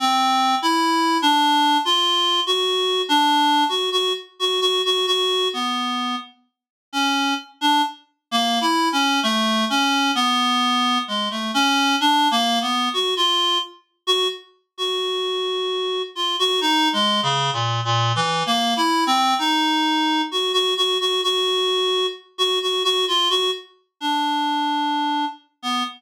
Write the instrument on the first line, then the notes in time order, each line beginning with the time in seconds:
clarinet
0.00 C4
0.62 E4
1.22 D4
1.85 F4
2.47 F#4
3.09 D4
3.69 F#4
3.92 F#4
4.39 F#4
4.61 F#4
4.85 F#4
5.07 F#4
5.53 B3
6.93 C#4
7.61 D4
8.31 A#3
8.61 E4
8.92 C#4
9.23 A3
9.70 C#4
10.15 B3
11.08 G#3
11.31 A3
11.54 C#4
12.01 D4
12.31 A#3
12.61 B3
12.93 F#4
13.17 F4
14.07 F#4
14.78 F#4
16.15 F4
16.39 F#4
16.61 D#4
16.93 G#3
17.23 C#3
17.53 A#2
17.85 A#2
18.16 E3
18.46 A#3
18.77 E4
19.07 C4
19.38 D#4
20.31 F#4
20.53 F#4
20.77 F#4
21.00 F#4
21.23 F#4
22.38 F#4
22.62 F#4
22.84 F#4
23.08 F4
23.30 F#4
24.00 D4
25.63 B3